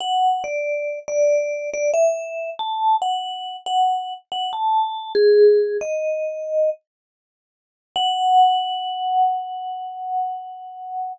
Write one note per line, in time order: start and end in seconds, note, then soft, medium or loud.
0.01 0.43 F#5 medium
0.44 0.99 D5 medium
1.08 1.70 D5 medium
1.74 1.91 D5 medium
1.94 2.50 E5 medium
2.59 2.96 A5 medium
3.02 3.56 F#5 medium
3.66 4.14 F#5 medium
4.32 4.51 F#5 medium
4.53 5.12 A5 medium
5.15 5.77 G#4 medium
5.81 6.70 D#5 medium
7.96 11.13 F#5 loud